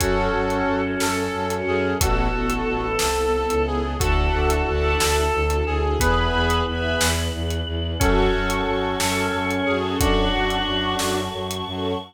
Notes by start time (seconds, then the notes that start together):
0.00 F#2 C#4 F#4 A4, kick, closed hi-hat
0.33 F#2 C#4 F#4 A4
0.50 C#4 F#4 A4, closed hi-hat
0.65 F#2 C#4 F#4 A4
1.00 F#2 A4, snare
1.17 C#4 F#4 A4
1.33 F#2 C#4 F#4 A4
1.50 C#4 F#4 A4, closed hi-hat
1.66 F#2 G#4
2.00 A1 B3 E4 F#4 A4, kick, closed hi-hat
2.33 A1 B3 E4 A4
2.49 B3 E4 A4, closed hi-hat
2.66 A1 B3 E4 A4
2.99 C2 A4, snare
3.16 B3 E4 A4
3.34 B3 E4 A4
3.50 C#2 B3 E4 A4, closed hi-hat
3.67 G#4
3.99 D2 D4 E4 F#4 A4 D5 E5 F#5 A5, kick, closed hi-hat
4.15 D5 E5 F#5 A5
4.33 D2
4.50 closed hi-hat
4.67 D2 D5 E5 F#5 A5
4.99 D2 A4, snare
5.33 D2
5.50 closed hi-hat
5.66 D2 G#4
6.00 E2 B3 E4 G#4 B4 E5 G#5 B5, kick, closed hi-hat
6.18 E5 G#5 B5
6.33 E2
6.50 closed hi-hat
6.66 E2 E5 G#5 B5
7.00 E2, snare
7.33 E2
7.51 closed hi-hat
7.67 E2
7.99 F#2 C#4 F#4 A4 F#5 A5 C#6, kick, closed hi-hat
8.33 F#2
8.50 closed hi-hat
8.67 F#2
8.83 C#4 F#4 A4
8.99 F#2 A4, snare
9.33 F#2
9.50 C#4 F#4 A4, closed hi-hat
9.66 F#2 C#4 F#4 G#4 A4
9.99 F#2 D4 F#4 F#5 A5 C#6, kick, closed hi-hat
10.33 F#2
10.50 closed hi-hat
10.67 F#2
10.84 C#4 F#4 A4
10.99 F#2, snare
11.33 F#2
11.51 C#4 F#4 A4, closed hi-hat
11.67 F#2 C#4 F#4 A4